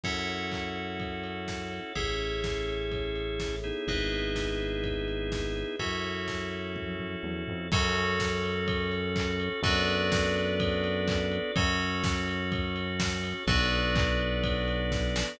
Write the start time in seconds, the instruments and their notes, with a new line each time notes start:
0.04 synth bass 1 F#2, drawbar organ C#4 E4 F#4 A4, tubular bells A4 C#5 E5 F#5, kick, crash
0.28 ride
0.52 kick, clap
0.76 ride
1.00 kick, ride
1.24 ride
1.48 kick, snare
1.72 ride
1.96 synth bass 1 A1, drawbar organ C#4 E4 G#4 A4, tubular bells G#4 A4 C#5 E5, kick, ride
2.20 ride
2.44 kick, snare
2.68 ride
2.92 kick, ride
3.16 ride
3.40 kick, snare
3.64 drawbar organ B3 D#4 E4 G#4, ride
3.87 synth bass 1 G#1, tubular bells G#4 B4 D#5 E5, kick, ride
4.12 ride
4.36 kick, snare
4.60 ride
4.84 kick, ride
5.08 ride
5.32 kick, snare
5.56 ride
5.79 synth bass 1 F#2, drawbar organ C#4 E4 F#4 A4, tubular bells F#4 A4 C#5 E5, kick, ride
6.04 ride
6.28 kick, snare
6.52 ride
6.76 kick, high tom
7.00 floor tom
7.23 synth bass 1 E2, high tom
7.48 synth bass 1 F2, floor tom
7.72 synth bass 1 F#2, drawbar organ C#4 F#4 A4, tubular bells F#4 A4 C#5, kick, crash
7.96 ride
8.20 kick, snare
8.44 ride
8.68 kick, ride
8.92 ride
9.16 kick, clap
9.40 ride
9.63 synth bass 1 F#2, drawbar organ B3 D4 F#4 A4, tubular bells F#4 A4 B4 D5, kick, ride
9.88 ride
10.12 kick, snare
10.36 ride
10.60 kick, ride
10.84 ride
11.08 kick, clap
11.32 ride
11.56 synth bass 1 F#2, drawbar organ C#4 F#4 A4, tubular bells F#4 A4 C#5, kick, ride
11.80 ride
12.04 kick, snare
12.28 ride
12.52 kick, ride
12.76 ride
13.00 kick, snare
13.24 ride
13.47 synth bass 1 B1, drawbar organ B3 D4 F#4 A4, tubular bells F#4 A4 B4 D5, kick, ride
13.72 ride
13.96 kick, clap
14.20 ride
14.44 kick, ride
14.68 ride
14.92 kick, snare
15.16 snare